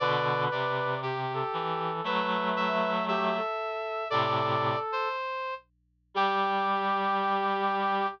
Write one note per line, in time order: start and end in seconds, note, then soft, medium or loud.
0.00 0.48 B2 medium
0.00 0.48 D3 loud
0.00 0.94 B4 medium
0.00 0.44 D5 medium
0.51 1.43 C3 medium
0.51 1.00 D5 medium
1.03 1.91 G4 medium
1.03 1.32 G4 medium
1.34 2.03 A4 medium
1.53 2.01 E3 medium
2.04 3.38 F#3 medium
2.04 3.38 A3 loud
2.04 2.92 B4 medium
2.04 2.50 E5 medium
2.57 3.05 E5 medium
3.08 3.34 G4 medium
3.08 4.08 E5 medium
3.36 4.04 A4 medium
4.10 4.76 A2 medium
4.10 4.76 C3 loud
4.10 5.08 A4 medium
4.10 4.79 D5 loud
4.92 5.54 C5 medium
6.14 8.06 G3 loud
6.14 8.07 G4 loud
6.14 8.08 G4 loud